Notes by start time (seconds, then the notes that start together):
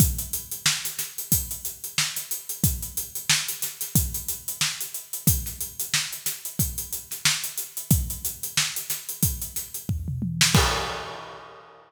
0.00 kick, closed hi-hat
0.19 closed hi-hat
0.33 closed hi-hat
0.52 closed hi-hat
0.66 snare
0.85 snare, closed hi-hat
0.99 snare, closed hi-hat
1.18 closed hi-hat
1.32 kick, closed hi-hat
1.51 closed hi-hat
1.65 closed hi-hat
1.84 closed hi-hat
1.98 snare
2.16 snare, closed hi-hat
2.31 closed hi-hat
2.49 closed hi-hat
2.64 kick, closed hi-hat
2.83 closed hi-hat
2.97 closed hi-hat
3.15 closed hi-hat
3.30 snare
3.48 closed hi-hat
3.62 snare, closed hi-hat
3.81 snare, closed hi-hat
3.95 kick, closed hi-hat
4.14 closed hi-hat
4.28 closed hi-hat
4.48 closed hi-hat
4.61 snare
4.81 closed hi-hat
4.94 closed hi-hat
5.13 closed hi-hat
5.27 kick, closed hi-hat
5.46 snare, closed hi-hat
5.61 closed hi-hat
5.80 closed hi-hat
5.94 snare
6.13 closed hi-hat
6.26 snare, closed hi-hat
6.45 closed hi-hat
6.59 kick, closed hi-hat
6.78 closed hi-hat
6.93 closed hi-hat
7.11 snare, closed hi-hat
7.25 snare
7.44 closed hi-hat
7.58 closed hi-hat
7.77 closed hi-hat
7.91 kick, closed hi-hat
8.10 closed hi-hat
8.25 closed hi-hat
8.43 closed hi-hat
8.57 snare
8.76 closed hi-hat
8.90 snare, closed hi-hat
9.09 closed hi-hat
9.23 kick, closed hi-hat
9.42 closed hi-hat
9.56 snare, closed hi-hat
9.74 closed hi-hat
9.89 kick, floor tom
10.08 mid tom
10.22 high tom
10.41 snare
10.55 kick, crash